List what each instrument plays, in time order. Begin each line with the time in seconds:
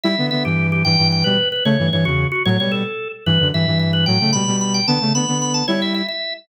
0.03 flute G3 E4, drawbar organ E5
0.18 flute D3 B3
0.31 flute D3 B3, drawbar organ E5
0.45 flute G2 E3, drawbar organ G4
0.72 drawbar organ G4
0.85 flute G2 E3, drawbar organ G5
0.98 flute G2 E3
1.12 drawbar organ G5
1.24 flute B2 G3, drawbar organ B4
1.52 drawbar organ B4
1.65 flute C#3 A3, drawbar organ C#5
1.79 flute G2 E3
1.92 flute G2 E3, drawbar organ C#5
2.05 flute E2 C#3, drawbar organ F#4
2.32 drawbar organ F#4
2.45 flute A2 F#3, drawbar organ C#5
2.59 flute B2 G3, drawbar organ C#5
2.72 drawbar organ A4
3.26 flute G2 E3, drawbar organ B4
3.40 flute F#2 D3
3.53 flute G2 E3, drawbar organ E5
3.67 flute G2 E3
3.79 drawbar organ E5
3.93 drawbar organ B4
4.06 flute A2 F#3, drawbar organ G5
4.20 flute C#3 A3
4.33 flute B2 G3, drawbar organ B5
4.47 flute B2 G3
4.61 drawbar organ B5
4.74 drawbar organ G5
4.87 flute D3 B3, drawbar organ A5
5.01 flute C#3 A3
5.14 flute D3 B3, drawbar organ B5
5.28 flute D3 B3
5.42 drawbar organ B5
5.54 drawbar organ A5
5.68 flute G3 E4, drawbar organ C#5
5.82 drawbar organ E5
5.95 drawbar organ E5
6.08 drawbar organ E5